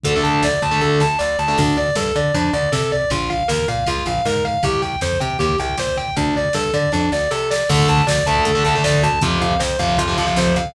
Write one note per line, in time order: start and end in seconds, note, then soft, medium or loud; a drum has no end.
0.04 0.21 D2 medium
0.04 0.12 D3 loud
0.04 0.12 A3 loud
0.04 0.23 A4 medium
0.04 kick medium
0.04 closed hi-hat loud
0.13 0.46 D3 medium
0.13 0.46 A3 medium
0.13 kick medium
0.23 0.41 D2 medium
0.23 0.41 A5 medium
0.23 kick medium
0.23 closed hi-hat medium
0.34 kick medium
0.43 0.59 D2 medium
0.43 0.62 D5 medium
0.43 kick medium
0.43 snare medium
0.54 kick medium
0.62 0.78 D2 medium
0.62 0.80 A5 medium
0.62 kick medium
0.62 closed hi-hat medium
0.71 1.02 D3 medium
0.71 1.02 A3 medium
0.71 kick medium
0.81 0.97 D2 medium
0.81 0.99 A4 medium
0.81 kick medium
1.00 1.17 D2 medium
1.00 1.18 A5 medium
1.00 snare medium
1.19 1.36 D2 medium
1.19 1.36 D5 medium
1.19 snare medium
1.39 1.55 D2 medium
1.39 1.57 A5 medium
1.48 1.56 D3 medium
1.48 1.56 A3 medium
1.57 1.91 D2 medium
1.57 1.76 D4 medium
1.57 kick loud
1.57 crash medium
1.67 kick medium
1.77 1.95 D5 medium
1.77 kick medium
1.77 ride soft
1.88 kick medium
1.95 2.12 G2 medium
1.95 2.14 A4 medium
1.95 kick medium
1.95 snare medium
2.06 kick medium
2.16 2.32 D3 medium
2.16 2.33 D5 soft
2.16 kick medium
2.16 ride medium
2.24 kick medium
2.34 2.51 F2 medium
2.34 2.52 D4 medium
2.34 kick medium
2.34 ride medium
2.44 kick medium
2.53 2.70 D2 medium
2.53 2.71 D5 medium
2.53 kick medium
2.53 ride medium
2.63 kick medium
2.72 3.05 C3 medium
2.72 2.90 A4 medium
2.72 kick medium
2.72 snare medium
2.81 kick medium
2.91 3.09 D5 medium
2.91 kick medium
2.91 ride medium
3.02 kick medium
3.10 3.43 A#1 medium
3.10 3.29 F4 medium
3.10 kick medium
3.10 ride medium
3.20 kick medium
3.30 3.47 F5 medium
3.30 kick medium
3.30 ride medium
3.40 kick medium
3.48 3.66 D#2 medium
3.48 3.66 A#4 medium
3.48 kick medium
3.48 snare medium
3.58 kick medium
3.68 3.84 A#2 medium
3.68 3.86 F5 medium
3.68 kick medium
3.68 ride medium
3.77 kick medium
3.86 4.04 C#2 medium
3.86 4.05 F4 medium
3.86 kick medium
3.86 ride medium
3.98 kick medium
4.05 4.22 A#1 medium
4.05 4.24 F5 medium
4.05 kick medium
4.05 ride medium
4.15 kick medium
4.25 4.58 G#2 medium
4.25 4.43 A#4 medium
4.25 kick medium
4.25 snare medium
4.36 kick medium
4.44 4.62 F5 medium
4.44 kick medium
4.44 ride medium
4.54 kick medium
4.63 4.96 C2 medium
4.63 4.81 G4 medium
4.63 kick medium
4.63 ride medium
4.74 kick medium
4.82 5.00 G5 medium
4.82 kick medium
4.82 ride medium
4.92 kick medium
5.01 5.18 F2 medium
5.01 5.19 C5 medium
5.01 kick medium
5.01 snare medium
5.12 kick medium
5.20 5.37 C3 medium
5.20 5.38 G5 medium
5.20 kick medium
5.20 ride medium
5.30 kick medium
5.39 5.56 D#2 medium
5.39 5.57 G4 medium
5.39 kick medium
5.39 ride medium
5.49 kick medium
5.58 5.76 C2 medium
5.58 5.77 G5 medium
5.58 kick medium
5.58 ride medium
5.69 kick medium
5.77 6.10 A#2 medium
5.77 5.97 C5 medium
5.77 kick medium
5.77 snare medium
5.87 kick medium
5.96 6.15 G5 medium
5.96 kick medium
5.96 ride medium
6.08 kick medium
6.16 6.49 D2 medium
6.16 6.34 D4 medium
6.16 kick medium
6.16 ride medium
6.27 kick medium
6.35 6.54 D5 medium
6.35 kick medium
6.35 ride medium
6.45 kick medium
6.53 6.71 G2 medium
6.53 6.72 A4 medium
6.53 kick medium
6.53 snare medium
6.65 kick medium
6.73 6.90 D3 medium
6.73 6.91 D5 medium
6.73 kick medium
6.73 ride medium
6.83 kick medium
6.92 7.09 F2 medium
6.92 7.10 D4 medium
6.92 kick medium
6.92 snare medium
7.12 7.28 D2 medium
7.12 7.30 D5 medium
7.12 snare medium
7.31 7.64 C3 medium
7.31 7.48 A4 medium
7.31 snare medium
7.50 7.68 D5 medium
7.50 snare medium
7.69 7.86 D2 medium
7.69 8.00 D3 loud
7.69 8.00 A3 loud
7.69 7.87 A4 medium
7.69 kick medium
7.69 crash loud
7.79 kick medium
7.88 8.05 D2 medium
7.88 8.06 A5 medium
7.88 kick medium
7.88 closed hi-hat medium
7.97 kick medium
8.07 8.23 D2 medium
8.07 8.24 D5 medium
8.07 kick medium
8.07 snare loud
8.18 kick medium
8.26 8.43 D2 medium
8.26 8.50 D3 medium
8.26 8.50 A3 medium
8.26 8.44 A5 medium
8.26 kick medium
8.26 closed hi-hat medium
8.36 kick medium
8.45 8.62 D2 medium
8.45 8.63 A4 medium
8.45 kick medium
8.45 closed hi-hat medium
8.55 8.63 D3 medium
8.55 8.63 A3 medium
8.55 kick medium
8.64 8.82 D2 medium
8.64 8.73 D3 loud
8.64 8.73 A3 medium
8.64 8.81 A5 medium
8.64 kick medium
8.64 closed hi-hat medium
8.75 9.06 D3 medium
8.75 9.06 A3 medium
8.75 kick medium
8.84 9.00 D2 medium
8.84 9.01 D5 medium
8.84 kick medium
8.84 snare loud
8.94 kick medium
9.03 9.19 D2 medium
9.03 9.21 A5 medium
9.03 kick medium
9.03 closed hi-hat medium
9.12 kick medium
9.21 9.38 F2 medium
9.21 9.53 C3 loud
9.21 9.53 F3 loud
9.21 9.40 F4 medium
9.21 kick loud
9.21 closed hi-hat medium
9.32 kick medium
9.41 9.57 F2 medium
9.41 9.59 F5 medium
9.41 kick medium
9.41 closed hi-hat medium
9.51 kick medium
9.59 9.77 F2 medium
9.59 9.77 C5 medium
9.59 kick medium
9.59 snare loud
9.70 kick medium
9.79 9.96 F2 medium
9.79 10.02 C3 medium
9.79 10.02 F3 medium
9.79 9.97 F5 medium
9.79 kick medium
9.79 closed hi-hat medium
9.89 kick medium
9.97 10.15 F2 medium
9.97 10.16 F4 medium
9.97 kick medium
9.97 closed hi-hat loud
10.08 10.15 C3 loud
10.08 10.15 F3 loud
10.08 kick medium
10.17 10.34 F2 medium
10.17 10.25 C3 medium
10.17 10.25 F3 medium
10.17 10.35 F5 medium
10.17 kick medium
10.17 closed hi-hat medium
10.27 10.57 C3 medium
10.27 10.57 F3 loud
10.27 kick medium
10.36 10.53 F2 medium
10.36 10.55 C5 medium
10.36 kick medium
10.36 snare medium
10.46 kick medium
10.56 10.72 F2 medium
10.56 10.74 F5 medium
10.56 kick medium
10.56 closed hi-hat medium
10.65 kick medium